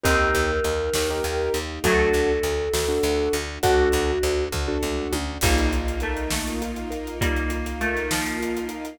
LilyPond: <<
  \new Staff \with { instrumentName = "Choir Aahs" } { \time 6/8 \key g \minor \tempo 4. = 67 bes'2. | a'2. | fis'4. r4. | \key bes \major r2. |
r2. | }
  \new Staff \with { instrumentName = "Harpsichord" } { \time 6/8 \key g \minor <c' ees'>2. | <fis a>2. | <d' fis'>4 r2 | \key bes \major <g bes>4 a8 a4. |
<g bes>4 a8 f4. | }
  \new Staff \with { instrumentName = "Acoustic Grand Piano" } { \time 6/8 \key g \minor <ees' g' bes'>4.~ <ees' g' bes'>16 <ees' g' bes'>4~ <ees' g' bes'>16 | <d' fis' a'>4.~ <d' fis' a'>16 <d' fis' a'>4~ <d' fis' a'>16 | <d' fis' a'>4.~ <d' fis' a'>16 <d' fis' a'>4~ <d' fis' a'>16 | \key bes \major ees'8 f'8 bes'8 ees'8 f'8 bes'8 |
ees'8 f'8 bes'8 ees'8 f'8 bes'8 | }
  \new Staff \with { instrumentName = "Electric Bass (finger)" } { \clef bass \time 6/8 \key g \minor ees,8 ees,8 ees,8 ees,8 ees,8 ees,8 | d,8 d,8 d,8 d,8 d,8 d,8 | d,8 d,8 d,8 d,8 d,8 d,8 | \key bes \major bes,,2.~ |
bes,,2. | }
  \new Staff \with { instrumentName = "String Ensemble 1" } { \time 6/8 \key g \minor <bes ees' g'>2. | <a d' fis'>2. | <a d' fis'>2. | \key bes \major <bes ees' f'>2.~ |
<bes ees' f'>2. | }
  \new DrumStaff \with { instrumentName = "Drums" } \drummode { \time 6/8 <hh bd>8 hh8 hh8 sn8 hh8 hh8 | <hh bd>8 hh8 hh8 sn8 hh8 hh8 | <hh bd>8 hh8 hh8 <bd tomfh>8 toml8 tommh8 | <cymc bd>16 hh16 hh16 hh16 hh16 hh16 sn16 hh16 hh16 hh16 hh16 hh16 |
<hh bd>16 hh16 hh16 hh16 hh16 hh16 sn16 hh16 hh16 hh16 hh16 hh16 | }
>>